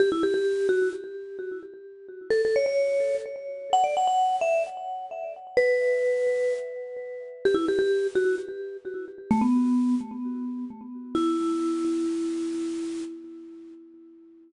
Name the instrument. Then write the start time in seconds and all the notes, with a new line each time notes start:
vibraphone
0.00 G4
0.12 E4
0.23 G4
0.34 G4
0.69 F#4
2.30 A4
2.45 A4
2.56 C#5
2.66 C#5
3.73 F#5
3.84 D5
3.97 F#5
4.07 F#5
4.41 E5
5.57 B4
7.45 G4
7.54 E4
7.68 G4
7.79 G4
8.15 F#4
9.31 A3
9.41 B3
11.15 E4